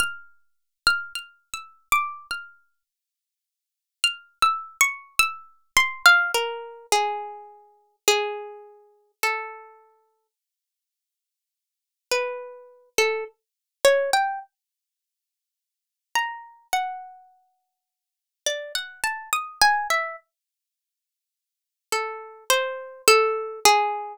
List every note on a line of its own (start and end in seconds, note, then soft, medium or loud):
0.00 0.78 F6 medium
0.87 1.13 F6 medium
1.15 1.50 F6 medium
1.54 1.88 E6 medium
1.92 2.27 D6 medium
2.31 2.83 F6 medium
4.04 4.38 F6 medium
4.42 4.77 E6 medium
4.81 5.15 C#6 loud
5.19 5.71 E6 loud
5.77 6.03 C6 loud
6.06 6.31 F5 loud
6.34 6.86 A#4 medium
6.92 7.96 G#4 medium
8.08 9.12 G#4 medium
9.23 10.27 A4 medium
12.12 12.89 B4 medium
12.98 13.24 A4 medium
13.85 14.11 C#5 medium
14.13 14.39 G5 medium
16.15 16.67 A#5 medium
16.73 18.29 F#5 medium
18.46 18.72 D5 medium
18.75 19.01 F#5 medium
19.04 19.30 A5 medium
19.33 19.59 D#6 medium
19.62 19.87 G#5 loud
19.90 20.16 E5 medium
21.92 22.44 A4 medium
22.50 23.02 C5 medium
23.08 23.60 A4 loud
23.65 24.17 G#4 loud